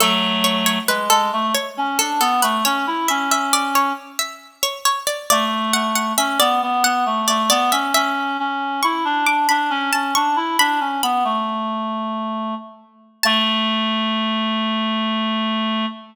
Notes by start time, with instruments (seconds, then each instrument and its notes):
0.00 clarinet F#3 A3, harpsichord A4
0.44 harpsichord C#5
0.66 harpsichord C#5
0.88 clarinet G#3, harpsichord B4
1.10 clarinet G#3, harpsichord A4
1.33 clarinet A3
1.55 harpsichord C#5
1.77 clarinet C#4
1.99 clarinet D4, harpsichord A4
2.20 clarinet B3, harpsichord A4
2.42 clarinet A3, harpsichord B4
2.65 clarinet C#4, harpsichord C#5
2.87 clarinet E4
3.08 clarinet C#4, harpsichord E5
3.31 harpsichord E5
3.53 harpsichord D5
3.75 harpsichord C#5
4.19 harpsichord E5
4.63 harpsichord C#5
4.85 harpsichord C#5
5.07 harpsichord D5
5.30 clarinet A3, harpsichord D5
5.73 clarinet A3, harpsichord F#5
5.95 harpsichord F#5
6.17 clarinet C#4, harpsichord E5
6.40 clarinet B3, harpsichord D5
6.62 clarinet B3
6.84 clarinet B3, harpsichord F#5
7.06 clarinet A3
7.28 clarinet A3, harpsichord D5
7.50 clarinet B3, harpsichord D5
7.72 clarinet C#4, harpsichord E5
7.94 clarinet C#4, harpsichord E5
8.39 clarinet C#4
8.83 clarinet E4, harpsichord C#6
9.05 clarinet D4
9.26 clarinet D4, harpsichord D6
9.49 clarinet D4, harpsichord B5
9.70 clarinet C#4
9.93 clarinet C#4, harpsichord A5
10.15 clarinet D4, harpsichord C#6
10.36 clarinet E4
10.59 clarinet D4, harpsichord B5
10.80 clarinet C#4
11.03 clarinet B3, harpsichord B5
11.24 clarinet A3
13.23 clarinet A3, harpsichord A5